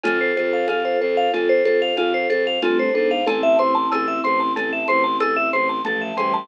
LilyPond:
<<
  \new Staff \with { instrumentName = "Vibraphone" } { \time 5/4 \key a \minor \tempo 4 = 93 f'16 c''16 a'16 f''16 f'16 c''16 a'16 f''16 f'16 c''16 a'16 f''16 f'16 c''16 a'16 f''16 f'16 c''16 a'16 f''16 | a'16 e''16 c''16 a''16 a'16 e''16 c''16 a''16 a'16 e''16 c''16 a''16 a'16 e''16 c''16 a''16 a'16 e''16 c''16 a''16 | }
  \new Staff \with { instrumentName = "Vibraphone" } { \time 5/4 \key a \minor <f' a'>1 <a c'>8 <b d'>8 | <c' e'>1 <f a>8 <e g>8 | }
  \new Staff \with { instrumentName = "Vibraphone" } { \time 5/4 \key a \minor a'8 c''8 f''8 c''8 a'8 c''8 f''8 c''8 a'8 c''8 | a''8 c'''8 e'''8 c'''8 a''8 c'''8 e'''8 c'''8 a''8 c'''8 | }
  \new Staff \with { instrumentName = "Violin" } { \clef bass \time 5/4 \key a \minor f,8 f,8 f,8 f,8 f,8 f,8 f,8 f,8 g,8 gis,8 | a,,8 a,,8 a,,8 a,,8 a,,8 a,,8 a,,8 a,,8 a,,8 a,,8 | }
  \new DrumStaff \with { instrumentName = "Drums" } \drummode { \time 5/4 <cgl cb>8 cgho8 <cgho cb>4 <cgl cb>8 cgho8 <cgho cb>8 cgho8 <cgl cb>4 | <cgl cb>8 cgho8 <cgho cb>8 cgho8 <cgl cb>8 cgho8 <cgho cb>8 cgho8 cgl8 <cgho cb>8 | }
>>